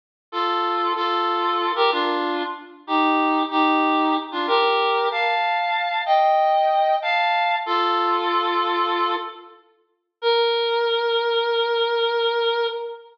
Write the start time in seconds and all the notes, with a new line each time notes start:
0.32 F4 A4
0.96 F4 A4
1.75 G4 A#4
1.91 D4 F4
2.87 D#4 G4
3.50 D#4 G4
4.32 D4 F4
4.47 G4 A#4
5.11 F5 A5
6.06 D#5 G5
7.02 F5 A5
7.66 F4 A4
10.22 A#4